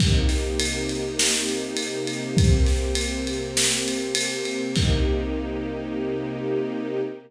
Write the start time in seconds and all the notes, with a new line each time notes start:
0.00 C3 A#3 D#4 G4, kick, crash
0.29 snare, ride
0.60 ride
0.89 ride
1.19 snare
1.49 ride
1.77 ride
2.07 ride
2.37 C3 A#3 C4 G4, kick, ride
2.66 snare, ride
2.95 ride
3.27 ride
3.57 snare
3.88 ride
4.15 ride
4.45 ride
4.75 C3 A#3 D#4 G4, kick, crash